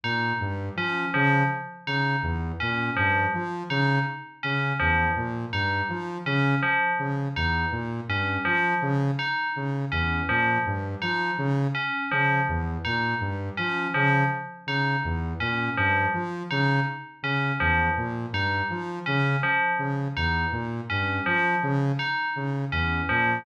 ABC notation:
X:1
M:4/4
L:1/8
Q:1/4=82
K:none
V:1 name="Lead 2 (sawtooth)" clef=bass
_B,, G,, F, _D, z D, E,, B,, | G,, F, _D, z D, E,, _B,, G,, | F, _D, z D, E,, _B,, G,, F, | _D, z D, E,, _B,, G,, F, D, |
z _D, E,, _B,, G,, F, D, z | _D, E,, _B,, G,, F, D, z D, | E,, _B,, G,, F, _D, z D, E,, | _B,, G,, F, _D, z D, E,, B,, |]
V:2 name="Tubular Bells"
_E z _D F, z E z D | F, z _E z _D F, z E | z _D F, z _E z D F, | z _E z _D F, z E z |
_D F, z _E z D F, z | _E z _D F, z E z D | F, z _E z _D F, z E | z _D F, z _E z D F, |]